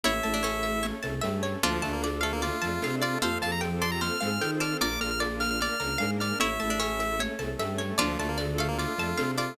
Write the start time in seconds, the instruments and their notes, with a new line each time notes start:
0.03 violin A1, string ensemble 1 C#4 E4 A4, vibraphone C#4 E4 A4, pizzicato strings E4 C#5, lead 1 (square) E5, low conga, shaker
0.23 violin A1, vibraphone A3, pizzicato strings A5, high conga, shaker
0.34 pizzicato strings D4
0.43 pizzicato strings C#4 C#5, high conga, shaker
0.63 pizzicato strings E5, high conga, shaker
0.83 string ensemble 1 A3 C#4 A4, pizzicato strings C#5, low conga, shaker
1.03 violin C2, vibraphone C3, pizzicato strings A5, high conga, shaker
1.21 violin G2, vibraphone G3, pizzicato strings E5, high conga, shaker
1.43 pizzicato strings C#5, shaker
1.62 violin D2, lead 1 (square) F3, string ensemble 1 D4 F4 A4, pizzicato strings D4 F4 D5, vibraphone D4 F4 A4, low conga, shaker
1.82 violin D2, vibraphone D3, lead 1 (square) A3, pizzicato strings A5, high conga, shaker
1.93 lead 1 (square) A#3
2.03 pizzicato strings D5, high conga, shaker
2.21 lead 1 (square) A3, pizzicato strings A4 F5, high conga, shaker
2.33 lead 1 (square) A#3
2.42 string ensemble 1 A3 D4 A4, lead 1 (square) F4, pizzicato strings D5, low conga, shaker
2.62 violin F2, vibraphone F3, pizzicato strings A5, high conga, shaker
2.82 violin C3, vibraphone C4, pizzicato strings F5, high conga, shaker
3.02 lead 1 (square) F4, pizzicato strings D5, shaker
3.21 violin F2, string ensemble 1 C4 F4 G4 A4, vibraphone F4 G4 A4, pizzicato strings A4 C5, lead 1 (square) F5, low conga, shaker
3.25 vibraphone C4
3.41 violin F2, vibraphone F3, pizzicato strings F5, lead 1 (square) A5, high conga, shaker
3.52 lead 1 (square) A#5
3.61 pizzicato strings G5, high conga, shaker
3.81 pizzicato strings D5 A5, lead 1 (square) C6, high conga, shaker
3.92 lead 1 (square) A#5
4.01 string ensemble 1 C4 F4 A4 C5, pizzicato strings C5, lead 1 (square) F6, low conga, shaker
4.21 violin G#2, vibraphone G#3, pizzicato strings F5, high conga, shaker
4.41 violin D#3, vibraphone D#4, pizzicato strings G5, high conga, shaker
4.60 pizzicato strings D5 A5, lead 1 (square) F6, shaker
4.80 violin A#1, string ensemble 1 D4 F4 A#4, vibraphone D4 F4 A#4, pizzicato strings A#4 D5, lead 1 (square) D6, low conga, shaker
5.00 violin A#1, vibraphone A#3, pizzicato strings A#5, lead 1 (square) F6, high conga, shaker
5.11 lead 1 (square) F6
5.20 pizzicato strings D5, high conga, shaker
5.40 pizzicato strings F5, lead 1 (square) F6, snare, high conga, shaker
5.50 lead 1 (square) F6
5.60 string ensemble 1 A#3 D4 A#4, pizzicato strings D5, lead 1 (square) F6, low conga, shaker
5.80 violin C#2, vibraphone C#3, pizzicato strings A#5, high conga, shaker
5.98 violin G#2, vibraphone G#3, pizzicato strings F5, high conga, shaker
6.20 pizzicato strings D5, lead 1 (square) F6, shaker
6.40 violin A1, string ensemble 1 C#4 E4 A4, vibraphone C#4 E4 A4, pizzicato strings E4 C#5, lead 1 (square) E5, low conga, shaker
6.60 violin A1, vibraphone A3, pizzicato strings A5, high conga, shaker
6.70 pizzicato strings D4
6.80 pizzicato strings C#4 C#5, high conga, shaker
7.00 pizzicato strings E5, high conga, shaker
7.19 string ensemble 1 A3 C#4 A4, pizzicato strings C#5, low conga, shaker
7.39 violin C2, vibraphone C3, pizzicato strings A5, high conga, shaker
7.58 violin G2, vibraphone G3, pizzicato strings E5, high conga, shaker
7.78 pizzicato strings C#5, shaker
7.98 violin D2, lead 1 (square) F3, pizzicato strings D4 F4 D5, string ensemble 1 D4 F4 A4, vibraphone D4 F4 A4, low conga, shaker
8.18 violin D2, vibraphone D3, lead 1 (square) A3, pizzicato strings A5, high conga, shaker
8.29 lead 1 (square) A#3
8.38 pizzicato strings D5, high conga, shaker
8.58 lead 1 (square) A3, pizzicato strings A4 F5, high conga, shaker
8.68 lead 1 (square) A#3
8.78 string ensemble 1 A3 D4 A4, lead 1 (square) F4, pizzicato strings D5, low conga, shaker
8.97 violin F2, vibraphone F3, pizzicato strings A5, high conga, shaker
9.17 violin C3, vibraphone C4, pizzicato strings F5, high conga, shaker
9.38 lead 1 (square) F4, pizzicato strings D5, shaker